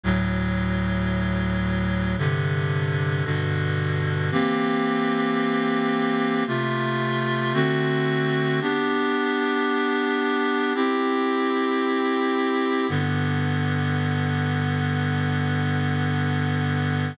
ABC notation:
X:1
M:4/4
L:1/8
Q:1/4=56
K:C
V:1 name="Clarinet"
[D,,A,,^F,]4 [G,,C,D,]2 [G,,B,,D,]2 | [E,_B,CG]4 [C,A,F]2 [D,A,C^F]2 | [B,DG]4 [CEG]4 | [K:G] [G,,D,B,]8 |]